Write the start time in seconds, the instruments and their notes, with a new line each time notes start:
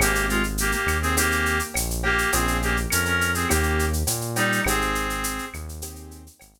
0.00 synth bass 1 G#1, clarinet A#3 G4, acoustic grand piano C4 D#4 G4 G#4, cowbell, claves, shaker
0.15 shaker
0.29 clarinet G#3 F4, shaker
0.43 shaker
0.58 clarinet A#3 G4, shaker
0.72 clarinet A#3 G4, shaker
0.86 synth bass 1 D#2, claves, shaker
1.02 clarinet C4 G#4, shaker
1.17 clarinet A#3 G4, acoustic grand piano C4 D#4 G4 G#4, cowbell, shaker
1.32 shaker
1.46 shaker
1.59 shaker
1.74 synth bass 1 A#1, cowbell, claves, shaker
1.90 shaker
2.03 clarinet A#3 G4, cowbell
2.18 shaker
2.32 synth bass 1 A#1, acoustic grand piano A#3 C#4 F4 G#4, clarinet C4 G#4, cowbell, shaker
2.48 shaker
2.62 clarinet A#3 G4, shaker
2.77 shaker
2.90 synth bass 1 F2, clarinet C#4 A#4, claves, shaker
3.05 clarinet C#4 A#4, shaker
3.21 shaker
3.34 clarinet C4 G#4, shaker
3.49 synth bass 1 D#2, clarinet A#3 G4, acoustic grand piano A#3 C#4 D#4 G4, cowbell, claves, shaker
3.63 shaker
3.79 shaker
3.93 shaker
4.07 synth bass 1 A#2, cowbell, shaker
4.21 shaker
4.36 clarinet G3 D#4, cowbell, shaker
4.52 shaker
4.64 synth bass 1 G#1, acoustic grand piano C4 D#4 G4 G#4, clarinet C4 G#4, cowbell, claves, shaker
4.81 shaker
4.95 shaker
5.10 shaker
5.24 shaker
5.38 shaker
5.54 synth bass 1 D#2, claves, shaker
5.69 shaker
5.82 acoustic grand piano C4 D#4 G4 G#4, cowbell, shaker
5.96 shaker
6.11 shaker
6.27 shaker
6.39 synth bass 1 G#1, cowbell, claves, shaker
6.54 shaker